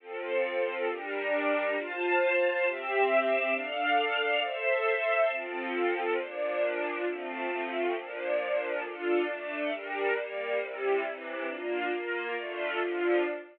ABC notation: X:1
M:6/8
L:1/8
Q:3/8=136
K:F
V:1 name="String Ensemble 1"
[F,CA]6 | [G,DB]6 | [Fca]6 | [CGe]6 |
[DAf]6 | [Ace]6 | [F,CA]6 | [B,,F,D]6 |
[F,A,C]6 | [B,,F,D]6 | [K:Dm] [DFA]3 [A,DA]3 | [G,DB]3 [G,B,B]3 |
[C,G,E]3 [C,E,E]3 | [B,DF]3 [B,FB]3 | [D,A,F]3 [D,F,F]3 |]